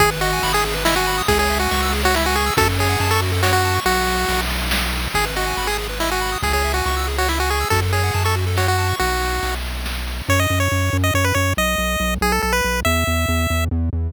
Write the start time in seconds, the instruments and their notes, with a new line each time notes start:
0.00 synth bass 1 G#1, lead 1 (square) G#4, kick, ride
0.11 lead 1 (square) B4
0.21 lead 1 (square) F#4 D#5, ride
0.33 lead 1 (square) G#5
0.43 synth bass 1 G#1, lead 1 (square) B5, ride
0.53 lead 1 (square) G#4 D#6
0.65 lead 1 (square) G#4, ride
0.74 lead 1 (square) B4
0.85 lead 1 (square) E4 D#5, snare
0.96 lead 1 (square) F#4 G#5
1.07 lead 1 (square) B5, ride
1.18 lead 1 (square) D#6
1.28 synth bass 1 C#2, lead 1 (square) G#4, kick, ride
1.39 lead 1 (square) G#4 C#5
1.50 lead 1 (square) E5, ride
1.59 lead 1 (square) F#4 G#5
1.71 synth bass 1 C#2, lead 1 (square) C#6, ride
1.82 lead 1 (square) E6
1.92 lead 1 (square) G#4, ride
2.03 lead 1 (square) F#4 C#5
2.14 lead 1 (square) E4 E5, snare
2.25 lead 1 (square) F#4 G#5
2.35 lead 1 (square) G#4 C#6, ride
2.46 lead 1 (square) E6
2.57 synth bass 1 F#2, lead 1 (square) F#4 A4, kick, ride
2.68 lead 1 (square) A4
2.79 lead 1 (square) G#4 C#5, ride
2.89 lead 1 (square) F#5
3.00 synth bass 1 F#2, lead 1 (square) A5, ride
3.11 lead 1 (square) A4 C#6
3.22 lead 1 (square) F#4, ride
3.32 lead 1 (square) A4
3.43 lead 1 (square) F#4 C#5, snare
3.53 lead 1 (square) F#4 F#5
3.64 lead 1 (square) A5, ride
3.75 lead 1 (square) C#6
3.86 synth bass 1 B1, lead 1 (square) F#4, ride
4.07 ride
4.28 synth bass 1 B1, ride
4.50 ride
4.71 snare
4.93 ride
5.14 synth bass 1 G#1, lead 1 (square) G#4, kick, ride
5.25 lead 1 (square) B4
5.36 lead 1 (square) F#4 D#5, ride
5.47 lead 1 (square) G#5
5.57 synth bass 1 G#1, lead 1 (square) B5, ride
5.67 lead 1 (square) G#4 D#6
5.78 lead 1 (square) G#4, ride
5.89 lead 1 (square) B4
6.00 lead 1 (square) E4 D#5, snare
6.11 lead 1 (square) F#4 G#5
6.21 lead 1 (square) B5, ride
6.32 lead 1 (square) D#6
6.42 synth bass 1 C#2, lead 1 (square) G#4, kick, ride
6.53 lead 1 (square) G#4 C#5
6.64 lead 1 (square) E5, ride
6.74 lead 1 (square) F#4 G#5
6.86 synth bass 1 C#2, lead 1 (square) C#6, ride
6.97 lead 1 (square) E6
7.07 lead 1 (square) G#4, ride
7.18 lead 1 (square) F#4 C#5
7.28 lead 1 (square) E4 E5, snare
7.39 lead 1 (square) F#4 G#5
7.50 lead 1 (square) G#4 C#6, ride
7.61 lead 1 (square) E6
7.70 synth bass 1 F#2, lead 1 (square) F#4 A4, kick, ride
7.82 lead 1 (square) A4
7.93 lead 1 (square) G#4 C#5, ride
8.03 lead 1 (square) F#5
8.14 synth bass 1 F#2, lead 1 (square) A5, ride
8.24 lead 1 (square) A4 C#6
8.36 lead 1 (square) F#4, ride
8.47 lead 1 (square) A4
8.57 lead 1 (square) F#4 C#5, snare
8.67 lead 1 (square) F#4 F#5
8.78 lead 1 (square) A5, ride
8.89 lead 1 (square) C#6
8.99 synth bass 1 B1, lead 1 (square) F#4, ride
9.22 ride
9.43 synth bass 1 B1, ride
9.64 ride
9.86 snare
10.07 ride
10.29 synth bass 1 F#2, lead 1 (square) C#5
10.40 lead 1 (square) D#5
10.50 synth bass 1 F#2
10.60 lead 1 (square) C#5
10.72 synth bass 1 F#2
10.93 synth bass 1 F#2
11.04 lead 1 (square) D#5
11.14 synth bass 1 F#2, lead 1 (square) C#5
11.24 lead 1 (square) B4
11.35 synth bass 1 F#2, lead 1 (square) C#5
11.57 synth bass 1 B1, lead 1 (square) D#5
11.78 synth bass 1 B1
12.00 synth bass 1 B1
12.21 synth bass 1 B1, lead 1 (square) G#4
12.32 lead 1 (square) A4
12.42 synth bass 1 B1, lead 1 (square) A4
12.53 lead 1 (square) B4
12.64 synth bass 1 B1
12.85 synth bass 1 E2, lead 1 (square) E5
13.07 synth bass 1 E2
13.29 synth bass 1 E2
13.50 synth bass 1 E2
13.71 synth bass 1 E2
13.93 synth bass 1 E2